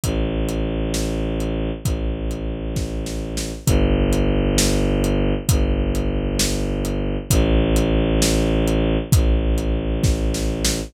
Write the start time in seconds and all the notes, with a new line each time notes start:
0.04 A1, kick, closed hi-hat
0.49 closed hi-hat
0.94 snare
1.40 closed hi-hat
1.85 A1, kick, closed hi-hat
2.31 closed hi-hat
2.76 kick, snare
3.06 snare
3.37 snare
3.66 G1, kick, closed hi-hat
4.13 closed hi-hat
4.58 snare
5.04 closed hi-hat
5.49 G1, kick, closed hi-hat
5.95 closed hi-hat
6.39 snare
6.85 closed hi-hat
7.30 A1, kick, closed hi-hat
7.76 closed hi-hat
8.22 snare
8.68 closed hi-hat
9.12 A1, kick, closed hi-hat
9.58 closed hi-hat
10.04 kick, snare
10.34 snare
10.65 snare